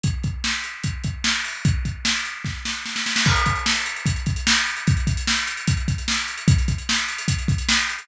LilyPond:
\new DrumStaff \drummode { \time 4/4 \tempo 4 = 149 <hh bd>8 <hh bd>8 sn8 hh8 <hh bd>8 <hh bd>8 sn8 hho8 | <hh bd>8 <hh bd>8 sn8 hh8 <bd sn>8 sn8 sn16 sn16 sn16 sn16 | <cymc bd>16 hh16 <hh bd>16 hh16 sn16 hh16 hh16 hh16 <hh bd>16 hh16 <hh bd>16 hh16 sn16 hh16 hh16 hh16 | <hh bd>16 hh16 <hh bd>16 hh16 sn16 hh16 hh16 hh16 <hh bd>16 hh16 <hh bd>16 hh16 sn16 hh16 hh16 hh16 |
<hh bd>16 hh16 <hh bd>16 hh16 sn16 hh16 hh16 hh16 <hh bd>16 hh16 <hh bd>16 hh16 sn16 hh16 hh16 hh16 | }